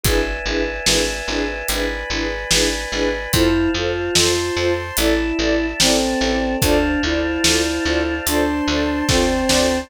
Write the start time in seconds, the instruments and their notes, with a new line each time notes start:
0.03 electric bass (finger) G#1, string ensemble 1 D4 E4 G#4 B4, choir aahs B4 D5 E5 G#5, kick, closed hi-hat
0.45 electric bass (finger) G#1, string ensemble 1 D4 E4 G#4 B4
0.86 electric bass (finger) G#1, string ensemble 1 D4 E4 G#4 B4, snare
1.28 electric bass (finger) G#1, string ensemble 1 D4 E4 G#4 B4
1.68 electric bass (finger) G#1, string ensemble 1 D4 E4 G#4 B4, choir aahs B4 D5 G#5 B5, closed hi-hat
2.10 electric bass (finger) G#1, string ensemble 1 D4 E4 G#4 B4
2.51 electric bass (finger) G#1, string ensemble 1 D4 E4 G#4 B4, snare
2.92 electric bass (finger) G#1, string ensemble 1 D4 E4 G#4 B4
3.33 electric bass (finger) F2, choir aahs E4 C5 F5 A5, string ensemble 1 F4 A4 C5, kick, closed hi-hat
3.74 electric bass (finger) F2, choir aahs F4, string ensemble 1 F4 A4 C5
4.15 electric bass (finger) F2, string ensemble 1 F4 A4 C5, choir aahs C5 A5 C6, snare
4.56 electric bass (finger) F2, string ensemble 1 F4 A4 C5
4.97 electric bass (finger) A1, string ensemble 1 E4 A4 D5, choir aahs E4 D5 E5 A5, closed hi-hat
5.39 electric bass (finger) A1, string ensemble 1 E4 A4 D5
5.80 electric bass (finger) A1, choir aahs C4 A4 D5 A5, string ensemble 1 E4 A4 D5, snare
6.21 electric bass (finger) A1, string ensemble 1 E4 A4 D5
6.62 electric bass (finger) D2, choir aahs D4 C5 D5 F5 A5, string ensemble 1 F4 A4 C5 D5, kick, closed hi-hat
7.03 electric bass (finger) D2, choir aahs E4, string ensemble 1 F4 A4 C5 D5
7.44 electric bass (finger) D2, string ensemble 1 F4 A4 C5 D5, snare
7.85 electric bass (finger) D2, string ensemble 1 F4 A4 C5 D5
8.26 electric bass (finger) D2, choir aahs D4 C5 D5 A5 C6, string ensemble 1 F4 A4 C5 D5, closed hi-hat
8.67 electric bass (finger) D2, string ensemble 1 F4 A4 C5 D5
9.08 electric bass (finger) D2, choir aahs C4, string ensemble 1 F4 A4 C5 D5, kick, snare
9.49 electric bass (finger) D2, string ensemble 1 F4 A4 C5 D5, snare